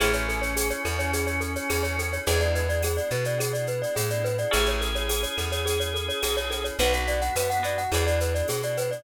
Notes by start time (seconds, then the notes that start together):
0.00 A1 C#4 E4 G#4 A4, cowbell, claves, shaker
0.13 C#5, shaker
0.29 A4, shaker
0.42 C#5, shaker
0.56 G#4, tambourine, cowbell, shaker
0.70 C#5, shaker
0.85 E2 A4, claves, shaker
0.99 C#5, shaker
1.13 G#4, cowbell, shaker
1.27 C#5, shaker
1.41 A4, shaker
1.56 C#5, shaker
1.69 E2 G#4, tambourine, cowbell, claves, shaker
1.83 C#5, shaker
1.99 A4, cowbell, shaker
2.13 C#5, shaker
2.26 E2 G#3 B3 D4 E4 G#4, cowbell, shaker
2.40 D5, shaker
2.55 B4, shaker
2.69 D5, shaker
2.83 G#4, tambourine, cowbell, claves, shaker
2.97 D5, shaker
3.10 B2 B4, shaker
3.24 D5, shaker
3.38 G#4, cowbell, claves, shaker
3.53 D5, shaker
3.67 B4, shaker
3.82 D5, shaker
3.95 A2 G#4, tambourine, cowbell, shaker
4.10 D5, shaker
4.24 B4, cowbell, shaker
4.38 D5, shaker
4.51 A1 C#4 E4 G#4 A4, cowbell, claves, shaker
4.66 C#5, shaker
4.81 A4, shaker
4.95 C#5, shaker
5.08 G#4, tambourine, cowbell, shaker
5.23 C#5, shaker
5.37 E2 A4, claves, shaker
5.52 C#5, shaker
5.66 G#4, cowbell, shaker
5.80 C#5, shaker
5.94 A4, shaker
6.08 C#5, shaker
6.22 B1 G#4, tambourine, cowbell, claves, shaker
6.37 C#5, shaker
6.51 A4, cowbell, shaker
6.64 C#5, shaker
6.79 B1 B3 D4 F#4 B4, cowbell, shaker
6.93 F#5, shaker
7.07 B3 D5, shaker
7.21 F#5, shaker
7.35 F#2 B4, tambourine, cowbell, claves, shaker
7.50 F#5, shaker
7.63 B3 D4 F#4 D5, shaker
7.78 F#5, shaker
7.92 E2 B3 D4 E4 G#4, cowbell, claves, shaker
8.07 D5, shaker
8.20 B4, shaker
8.35 D5, shaker
8.48 B2 G#4, tambourine, cowbell, shaker
8.63 D5, shaker
8.77 B4, cowbell, shaker
8.91 D5, shaker